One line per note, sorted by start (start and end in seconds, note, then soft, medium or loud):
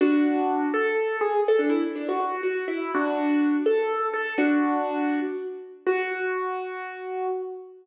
0.01 0.66 D4 medium
0.01 0.66 F#4 loud
0.74 1.17 A4 loud
1.21 1.41 G#4 loud
1.48 1.60 A4 loud
1.59 1.70 D4 medium
1.70 1.81 E4 loud
1.96 2.07 D4 medium
2.09 2.19 F#4 medium
2.20 2.41 F#4 medium
2.43 2.65 F#4 medium
2.68 2.91 E4 medium
2.95 3.56 D4 medium
2.95 3.56 F#4 medium
3.66 4.07 A4 loud
4.14 4.34 A4 medium
4.38 5.20 D4 medium
4.38 5.20 F#4 loud
5.87 7.27 F#4 loud